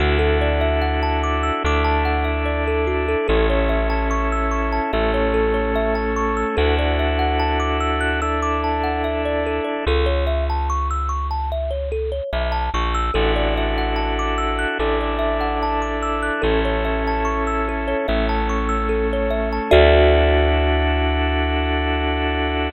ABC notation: X:1
M:4/4
L:1/16
Q:1/4=73
K:Dlyd
V:1 name="Kalimba"
F A d e f a d' e' d' a f e d A F A | A c e a c' e' c' a e c A c e a c' e' | A d e f a d' e' f' e' d' a f e d A d | A c e a c' e' c' a e c A c e a c' e' |
A d e f a d' e' f' A d e f a d' e' f' | A c e a c' e' A c e a c' e' A c e a | [FAde]16 |]
V:2 name="Electric Bass (finger)" clef=bass
D,,8 D,,8 | A,,,8 A,,,8 | D,,16 | C,,12 B,,,2 ^A,,,2 |
A,,,8 A,,,8 | A,,,8 A,,,8 | D,,16 |]
V:3 name="Drawbar Organ"
[DEFA]8 [DEAd]8 | [CEA]8 [A,CA]8 | [DEFA]8 [DEAd]8 | z16 |
[DEFA]8 [DEAd]8 | [CEA]8 [A,CA]8 | [DEFA]16 |]